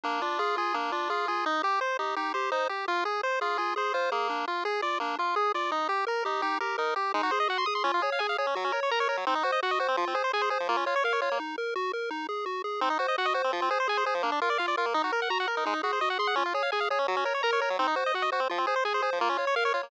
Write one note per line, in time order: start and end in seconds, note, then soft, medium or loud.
0.04 0.22 A#3 medium
0.04 0.20 D4 medium
0.22 0.39 D4 medium
0.22 0.38 F4 medium
0.39 0.57 F4 medium
0.39 0.56 G#4 medium
0.57 0.73 F4 medium
0.57 0.76 G#4 medium
0.74 0.92 A#3 medium
0.74 0.91 D4 medium
0.92 1.10 D4 medium
0.92 1.08 F4 medium
1.10 1.28 F4 medium
1.10 1.26 G#4 medium
1.28 1.45 F4 medium
1.28 1.45 G#4 medium
1.46 1.62 D#4 medium
1.63 1.79 G4 medium
1.63 1.80 G4 medium
1.81 1.97 C5 medium
1.99 2.15 D#4 medium
1.99 2.15 G4 medium
2.16 2.33 D#4 medium
2.16 2.32 G4 medium
2.34 2.51 G4 medium
2.34 2.50 C5 medium
2.52 2.68 D#4 medium
2.52 2.68 C5 medium
2.69 2.85 G4 medium
2.69 2.86 G4 medium
2.88 3.04 F4 medium
3.05 3.21 G#4 medium
3.23 3.40 C5 medium
3.23 3.39 C5 medium
3.41 3.57 F4 medium
3.41 3.57 G#4 medium
3.58 3.75 F4 medium
3.58 3.74 G#4 medium
3.76 3.92 G#4 medium
3.76 3.93 C5 medium
3.94 4.10 F4 medium
3.94 4.11 C5 medium
4.12 4.45 A#3 medium
4.12 4.28 G#4 medium
4.30 4.46 D4 medium
4.48 4.64 F4 medium
4.65 4.81 G#4 medium
4.82 4.99 F4 medium
4.82 4.98 D5 medium
5.00 5.16 A#3 medium
5.00 5.17 D4 medium
5.18 5.35 F4 medium
5.36 5.52 G#4 medium
5.54 5.71 F4 medium
5.54 5.71 D5 medium
5.71 5.88 D#4 medium
5.89 6.05 G4 medium
6.07 6.23 A#4 medium
6.07 6.24 A#4 medium
6.25 6.42 D#4 medium
6.25 6.41 G4 medium
6.42 6.59 D#4 medium
6.42 6.58 G4 medium
6.60 6.77 G4 medium
6.60 6.76 A#4 medium
6.78 6.94 D#4 medium
6.78 6.94 A#4 medium
6.96 7.12 G4 medium
6.96 7.13 G4 medium
7.14 7.22 G#3 medium
7.14 7.31 D#4 medium
7.23 7.31 F#4 medium
7.31 7.48 G#4 medium
7.31 7.39 C5 medium
7.40 7.48 D#5 medium
7.48 7.65 F#4 medium
7.48 7.58 F#5 medium
7.58 7.66 C6 medium
7.66 7.84 G#4 medium
7.66 7.74 D#6 medium
7.75 7.83 C6 medium
7.84 7.92 C#4 medium
7.84 8.00 F4 medium
7.94 8.02 F4 medium
8.02 8.10 G#4 medium
8.02 8.19 C#5 medium
8.12 8.20 F5 medium
8.19 8.36 G#4 medium
8.19 8.27 G#5 medium
8.29 8.37 F5 medium
8.38 8.46 G#4 medium
8.38 8.55 C#5 medium
8.47 8.55 C#4 medium
8.55 8.64 F#3 medium
8.55 8.72 F#4 medium
8.64 8.72 C#4 medium
8.72 8.80 A#4 medium
8.72 8.90 C#5 medium
8.83 8.91 C#5 medium
8.91 9.08 A#4 medium
8.91 8.99 A#5 medium
9.00 9.08 C#5 medium
9.09 9.17 A#4 medium
9.09 9.25 C#5 medium
9.17 9.25 F#3 medium
9.27 9.35 C4 medium
9.27 9.43 D#4 medium
9.35 9.43 D#4 medium
9.43 9.51 F#4 medium
9.43 9.61 C5 medium
9.52 9.60 D#5 medium
9.63 9.79 F#4 medium
9.63 9.71 F#5 medium
9.71 9.79 D#5 medium
9.79 9.87 F#4 medium
9.79 9.96 C5 medium
9.88 9.96 C4 medium
9.97 10.05 F3 medium
9.97 10.14 F4 medium
10.07 10.15 C4 medium
10.15 10.23 G#4 medium
10.15 10.31 C5 medium
10.24 10.32 C5 medium
10.33 10.50 G#4 medium
10.33 10.42 G#5 medium
10.42 10.50 C5 medium
10.50 10.58 G#4 medium
10.50 10.67 C5 medium
10.60 10.68 F3 medium
10.69 10.77 A#3 medium
10.69 10.85 F4 medium
10.77 10.85 C#4 medium
10.86 10.95 F4 medium
10.86 11.03 C#5 medium
10.96 11.04 C#5 medium
11.04 11.20 A#4 medium
11.04 11.13 F5 medium
11.13 11.21 C#5 medium
11.21 11.30 F4 medium
11.21 11.38 C#5 medium
11.31 11.39 A#3 medium
11.40 11.56 D#4 medium
11.58 11.74 A#4 medium
11.76 11.92 F#4 medium
11.93 12.10 A#4 medium
12.11 12.27 D#4 medium
12.29 12.45 G#4 medium
12.46 12.62 F#4 medium
12.64 12.80 G#4 medium
12.81 12.89 C4 medium
12.81 12.98 D#4 medium
12.90 12.98 D#4 medium
12.99 13.07 F#4 medium
12.99 13.16 C5 medium
13.08 13.16 D#5 medium
13.18 13.34 F#4 medium
13.18 13.26 F#5 medium
13.25 13.33 D#5 medium
13.34 13.42 F#4 medium
13.34 13.51 C5 medium
13.44 13.52 C4 medium
13.53 13.61 F3 medium
13.53 13.69 F4 medium
13.62 13.70 C4 medium
13.70 13.78 G#4 medium
13.70 13.87 C5 medium
13.80 13.88 C5 medium
13.88 14.04 G#4 medium
13.88 13.97 G#5 medium
13.97 14.05 C5 medium
14.06 14.14 G#4 medium
14.06 14.22 C5 medium
14.14 14.22 F3 medium
14.23 14.31 A#3 medium
14.23 14.40 D4 medium
14.32 14.40 D4 medium
14.41 14.49 F4 medium
14.41 14.58 A#4 medium
14.50 14.58 D5 medium
14.58 14.76 F4 medium
14.58 14.66 F5 medium
14.68 14.76 D5 medium
14.77 14.86 F4 medium
14.77 14.94 A#4 medium
14.86 14.94 A#3 medium
14.94 15.02 D#4 medium
14.94 15.11 D#4 medium
15.04 15.12 F#4 medium
15.12 15.29 A#4 medium
15.12 15.21 A#4 medium
15.22 15.30 F#5 medium
15.30 15.46 F#4 medium
15.30 15.38 A#5 medium
15.40 15.48 F#5 medium
15.47 15.55 A#4 medium
15.47 15.64 A#4 medium
15.57 15.65 D#4 medium
15.65 15.74 G#3 medium
15.65 15.82 D#4 medium
15.73 15.81 D#4 medium
15.83 15.92 F#4 medium
15.83 15.99 G#4 medium
15.93 16.01 C5 medium
16.01 16.18 F#4 medium
16.01 16.09 D#5 medium
16.10 16.18 F#5 medium
16.19 16.35 G#4 medium
16.19 16.27 C6 medium
16.27 16.35 F#5 medium
16.36 16.43 C#4 medium
16.36 16.53 F4 medium
16.46 16.54 F4 medium
16.54 16.63 G#4 medium
16.54 16.70 C#5 medium
16.63 16.71 F5 medium
16.72 16.89 G#4 medium
16.72 16.80 G#5 medium
16.80 16.88 F5 medium
16.90 16.99 G#4 medium
16.90 17.07 C#5 medium
16.99 17.07 C#4 medium
17.08 17.16 F#3 medium
17.08 17.24 F#4 medium
17.16 17.24 C#4 medium
17.25 17.33 A#4 medium
17.25 17.41 C#5 medium
17.34 17.42 C#5 medium
17.43 17.60 A#4 medium
17.43 17.51 A#5 medium
17.53 17.61 C#5 medium
17.60 17.69 A#4 medium
17.60 17.77 C#5 medium
17.70 17.78 F#3 medium
17.79 17.87 C4 medium
17.79 17.95 D#4 medium
17.87 17.95 D#4 medium
17.96 18.04 F#4 medium
17.96 18.12 C5 medium
18.06 18.14 D#5 medium
18.14 18.30 F#4 medium
18.14 18.23 F#5 medium
18.22 18.30 D#5 medium
18.32 18.40 F#4 medium
18.32 18.48 C5 medium
18.40 18.48 C4 medium
18.49 18.59 F3 medium
18.49 18.66 F4 medium
18.58 18.66 C4 medium
18.67 18.75 G#4 medium
18.67 18.84 C5 medium
18.76 18.84 C5 medium
18.85 19.01 G#4 medium
18.85 18.93 G#5 medium
18.94 19.02 C5 medium
19.02 19.10 G#4 medium
19.02 19.19 C5 medium
19.13 19.20 F3 medium
19.21 19.29 A#3 medium
19.21 19.37 F4 medium
19.29 19.37 C#4 medium
19.37 19.45 F4 medium
19.37 19.55 C#5 medium
19.47 19.55 C#5 medium
19.56 19.72 A#4 medium
19.56 19.64 F5 medium
19.65 19.73 C#5 medium
19.74 19.82 F4 medium
19.74 19.90 C#5 medium
19.83 19.90 A#3 medium